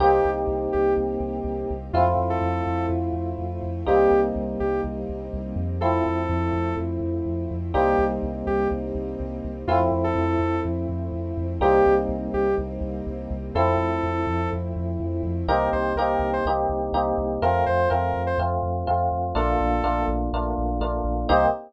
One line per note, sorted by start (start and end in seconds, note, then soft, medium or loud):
0.00 0.20 C2 loud
0.00 1.74 A#3 medium
0.00 1.92 A#3 medium
0.00 1.74 C4 medium
0.00 1.92 C4 medium
0.00 1.74 D#4 medium
0.00 1.92 D#4 medium
0.00 1.74 G4 medium
0.00 0.30 G4 loud
0.00 1.92 G4 medium
0.25 0.45 C2 medium
0.47 0.68 C2 medium
0.72 0.95 C2 medium
0.72 0.94 G4 medium
0.97 1.17 C2 medium
1.20 1.41 C2 medium
1.44 1.65 C2 medium
1.70 1.91 C2 medium
1.93 2.14 F2 loud
1.93 3.85 A3 medium
1.93 3.69 A3 medium
1.93 3.85 C4 medium
1.93 3.69 C4 medium
1.93 3.85 E4 medium
1.93 3.69 E4 medium
1.93 2.05 F4 loud
1.93 3.85 F4 medium
1.93 3.69 F4 medium
2.17 2.37 F2 medium
2.30 2.86 A4 loud
2.41 2.62 F2 medium
2.66 2.87 F2 medium
2.89 3.10 F2 medium
3.13 3.33 F2 medium
3.38 3.59 F2 medium
3.63 3.83 F2 medium
3.86 4.07 C2 medium
3.86 5.60 G3 medium
3.86 5.79 G3 medium
3.86 5.60 A#3 medium
3.86 5.79 A#3 medium
3.86 5.60 C4 medium
3.86 5.79 C4 medium
3.86 5.60 D#4 medium
3.86 5.79 D#4 medium
3.86 4.20 G4 loud
4.11 4.31 C2 medium
4.36 4.56 C2 medium
4.60 4.81 C2 medium
4.60 4.81 G4 medium
4.84 5.05 C2 medium
5.09 5.30 C2 medium
5.33 5.54 C2 medium
5.56 6.01 F2 loud
5.80 7.72 F3 medium
5.80 7.56 F3 medium
5.80 7.72 A3 medium
5.80 7.56 A3 medium
5.80 7.72 C4 medium
5.80 7.56 C4 medium
5.80 7.72 E4 medium
5.80 7.56 E4 medium
5.80 6.75 A4 loud
6.06 6.27 F2 medium
6.29 6.50 F2 loud
6.53 6.73 F2 medium
6.77 6.98 F2 medium
7.01 7.21 F2 medium
7.26 7.46 F2 medium
7.51 7.72 F2 medium
7.73 7.95 C2 loud
7.73 9.65 G3 medium
7.73 9.48 G3 medium
7.73 9.65 A#3 medium
7.73 9.48 A#3 medium
7.73 9.65 C4 medium
7.73 9.48 C4 medium
7.73 9.65 D#4 medium
7.73 9.48 D#4 medium
7.73 8.04 G4 loud
7.99 8.19 C2 medium
8.23 8.43 C2 medium
8.47 8.67 C2 medium
8.47 8.68 G4 loud
8.71 8.92 C2 medium
8.95 9.15 C2 medium
9.20 9.41 C2 medium
9.44 9.65 C2 medium
9.67 9.88 F2 medium
9.67 11.59 F3 medium
9.67 11.43 F3 medium
9.67 11.59 A3 medium
9.67 11.43 A3 medium
9.67 11.59 C4 medium
9.67 11.43 C4 medium
9.67 11.59 E4 medium
9.67 11.43 E4 medium
9.67 9.79 F4 loud
9.92 10.12 F2 medium
10.04 10.60 A4 loud
10.15 10.36 F2 loud
10.39 10.60 F2 medium
10.65 10.86 F2 medium
10.89 11.09 F2 medium
11.12 11.33 F2 medium
11.37 11.58 F2 medium
11.60 11.81 C2 loud
11.60 13.35 G3 medium
11.60 13.54 G3 medium
11.60 13.35 A#3 medium
11.60 13.54 A#3 medium
11.60 13.35 C4 medium
11.60 13.54 C4 medium
11.60 13.35 D#4 medium
11.60 13.54 D#4 medium
11.60 11.94 G4 loud
11.86 12.07 C2 medium
12.09 12.29 C2 medium
12.34 12.54 C2 medium
12.34 12.55 G4 loud
12.58 12.79 C2 medium
12.81 13.02 C2 medium
13.07 13.27 C2 medium
13.30 13.51 C2 loud
13.55 13.76 F2 loud
13.55 15.46 F3 medium
13.55 15.30 F3 medium
13.55 15.46 A3 medium
13.55 15.30 A3 medium
13.55 15.46 C4 medium
13.55 15.30 C4 medium
13.55 15.46 E4 medium
13.55 15.30 E4 medium
13.55 14.49 A4 loud
13.77 13.98 F2 medium
14.03 14.24 F2 medium
14.27 14.47 F2 medium
14.53 14.73 F2 medium
14.76 14.97 F2 medium
15.00 15.20 F2 medium
15.23 15.44 F2 loud
15.48 15.69 C2 loud
15.48 15.92 A#3 medium
15.48 15.92 C4 medium
15.48 15.92 D#4 medium
15.48 15.92 G4 medium
15.48 15.69 A#4 loud
15.72 15.94 C2 medium
15.72 15.93 C5 loud
15.96 16.16 C2 medium
15.96 16.42 A#3 medium
15.96 16.42 C4 medium
15.96 16.42 D#4 medium
15.96 16.42 G4 medium
15.96 16.31 A#4 loud
16.19 16.40 C2 medium
16.33 16.45 C5 loud
16.45 16.66 C2 medium
16.45 16.90 A#3 medium
16.45 16.90 C4 medium
16.45 16.90 D#4 medium
16.45 16.90 G4 medium
16.69 16.90 C2 medium
16.92 17.13 C2 medium
16.92 17.37 A#3 medium
16.92 17.37 C4 medium
16.92 17.37 D#4 medium
16.92 17.37 G4 medium
17.18 17.38 C2 medium
17.42 17.63 F2 medium
17.42 17.85 A3 medium
17.42 17.85 C4 medium
17.42 17.85 F4 medium
17.42 17.64 A#4 loud
17.66 17.87 F2 medium
17.66 17.89 C5 loud
17.90 18.12 F2 medium
17.90 18.33 A3 medium
17.90 18.33 C4 medium
17.90 18.33 F4 medium
17.90 18.22 A#4 medium
18.14 18.34 F2 medium
18.27 18.38 C5 loud
18.38 18.58 F2 medium
18.38 18.83 A3 medium
18.38 18.83 C4 medium
18.38 18.83 F4 medium
18.63 18.83 F2 medium
18.87 19.09 F2 medium
18.87 19.30 A3 medium
18.87 19.30 C4 medium
18.87 19.30 F4 medium
19.12 19.32 F2 medium
19.35 19.56 A#1 loud
19.35 19.78 A3 medium
19.35 19.78 A#3 medium
19.35 19.78 D4 medium
19.35 19.78 F4 medium
19.35 20.06 A4 loud
19.60 19.81 A#1 medium
19.83 20.04 A#1 medium
19.83 20.27 A3 medium
19.83 20.27 A#3 medium
19.83 20.27 D4 medium
19.83 20.27 F4 medium
20.08 20.28 A#1 medium
20.33 20.54 A#1 medium
20.33 20.77 A3 medium
20.33 20.77 A#3 medium
20.33 20.77 D4 medium
20.33 20.77 F4 medium
20.58 20.79 A#1 medium
20.80 21.01 A#1 medium
20.80 21.24 A3 medium
20.80 21.24 A#3 medium
20.80 21.24 D4 medium
20.80 21.24 F4 medium
21.04 21.25 A#1 medium
21.29 21.47 C2 loud
21.29 21.46 A#3 loud
21.29 21.46 C4 medium
21.29 21.46 D#4 loud
21.29 21.46 G4 medium
21.29 21.46 C5 loud